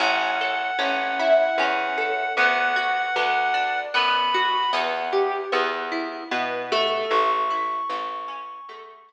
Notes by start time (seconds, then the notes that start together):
0.00 A1 C#4 F#5
0.41 A4
0.79 A1 C#4
1.19 E4
1.58 E2 C#4
1.98 A4
2.37 D2 B3 F#5
2.76 F#4
3.16 D2 B3
3.54 D4
3.94 F#2 B3 B5
4.34 F#4
4.73 E2 B3
5.13 G4
5.52 E2 B3
5.92 E4
6.31 B2 B3
6.72 A3
7.11 A1 C#6
7.50 E4
7.89 A1 A3
8.28 C#4
8.69 E2 A3
9.09 E4